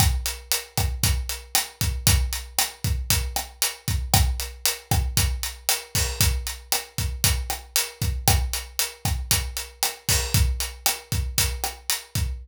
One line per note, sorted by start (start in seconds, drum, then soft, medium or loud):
0.00 kick medium
0.00 cross-stick medium
0.00 closed hi-hat medium
0.26 closed hi-hat medium
0.52 closed hi-hat medium
0.77 kick medium
0.77 cross-stick medium
0.77 closed hi-hat medium
1.03 kick medium
1.03 closed hi-hat medium
1.29 closed hi-hat medium
1.55 cross-stick medium
1.55 closed hi-hat medium
1.81 kick medium
1.81 closed hi-hat medium
2.07 kick medium
2.07 closed hi-hat loud
2.33 closed hi-hat medium
2.59 cross-stick medium
2.59 closed hi-hat medium
2.84 kick medium
2.84 closed hi-hat medium
3.10 kick medium
3.10 closed hi-hat medium
3.36 cross-stick medium
3.36 closed hi-hat medium
3.62 closed hi-hat medium
3.88 kick medium
3.88 closed hi-hat medium
4.14 kick medium
4.14 cross-stick medium
4.14 closed hi-hat medium
4.40 closed hi-hat medium
4.66 closed hi-hat medium
4.91 kick medium
4.91 cross-stick medium
4.91 closed hi-hat medium
5.17 kick medium
5.17 closed hi-hat medium
5.43 closed hi-hat medium
5.69 cross-stick medium
5.69 closed hi-hat medium
5.95 kick medium
5.95 open hi-hat medium
6.20 kick medium
6.20 closed hi-hat medium
6.47 closed hi-hat medium
6.72 cross-stick medium
6.72 closed hi-hat medium
6.98 kick medium
6.98 closed hi-hat medium
7.24 kick medium
7.24 closed hi-hat medium
7.50 cross-stick medium
7.50 closed hi-hat medium
7.76 closed hi-hat loud
8.02 kick medium
8.02 closed hi-hat medium
8.28 kick medium
8.28 cross-stick medium
8.28 closed hi-hat medium
8.53 closed hi-hat medium
8.79 closed hi-hat medium
9.05 kick medium
9.05 cross-stick medium
9.05 closed hi-hat medium
9.31 kick medium
9.31 closed hi-hat medium
9.57 closed hi-hat medium
9.83 cross-stick medium
9.83 closed hi-hat medium
10.09 kick medium
10.09 open hi-hat medium
10.34 kick medium
10.34 closed hi-hat medium
10.60 closed hi-hat medium
10.86 cross-stick medium
10.86 closed hi-hat medium
11.12 kick medium
11.12 closed hi-hat medium
11.38 kick medium
11.38 closed hi-hat loud
11.64 cross-stick medium
11.64 closed hi-hat medium
11.90 closed hi-hat medium
12.15 kick medium
12.15 closed hi-hat medium